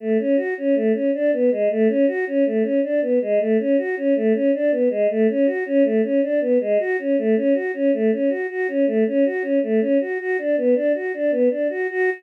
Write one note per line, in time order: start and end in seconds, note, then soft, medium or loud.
0.00 0.18 A3 medium
0.19 0.36 C#4 medium
0.37 0.54 F#4 medium
0.58 0.75 C#4 medium
0.75 0.92 A3 medium
0.93 1.11 C#4 medium
1.14 1.31 D4 medium
1.33 1.50 B3 medium
1.51 1.68 G#3 medium
1.70 1.88 A3 medium
1.88 2.06 C#4 medium
2.07 2.25 F#4 medium
2.27 2.44 C#4 medium
2.46 2.63 A3 medium
2.63 2.80 C#4 medium
2.83 3.00 D4 medium
3.02 3.19 B3 medium
3.22 3.39 G#3 medium
3.40 3.57 A3 medium
3.59 3.76 C#4 medium
3.78 3.95 F#4 medium
3.97 4.14 C#4 medium
4.16 4.33 A3 medium
4.34 4.51 C#4 medium
4.54 4.71 D4 medium
4.71 4.89 B3 medium
4.90 5.07 G#3 medium
5.10 5.27 A3 medium
5.29 5.46 C#4 medium
5.46 5.64 F#4 medium
5.66 5.83 C#4 medium
5.84 6.01 A3 medium
6.03 6.21 C#4 medium
6.22 6.40 D4 medium
6.41 6.58 B3 medium
6.60 6.78 G#3 medium
6.79 6.97 F#4 medium
6.99 7.16 C#4 medium
7.18 7.35 A3 medium
7.36 7.54 C#4 medium
7.54 7.72 F#4 medium
7.74 7.91 C#4 medium
7.93 8.11 A3 medium
8.12 8.29 C#4 medium
8.29 8.47 F#4 medium
8.50 8.67 F#4 medium
8.68 8.85 C#4 medium
8.87 9.04 A3 medium
9.07 9.24 C#4 medium
9.25 9.43 F#4 medium
9.42 9.59 C#4 medium
9.63 9.80 A3 medium
9.80 9.98 C#4 medium
10.01 10.18 F#4 medium
10.20 10.37 F#4 medium
10.38 10.56 D4 medium
10.57 10.75 B3 medium
10.75 10.92 D4 medium
10.95 11.12 F#4 medium
11.14 11.31 D4 medium
11.31 11.49 B3 medium
11.50 11.68 D4 medium
11.70 11.87 F#4 medium
11.90 12.10 F#4 loud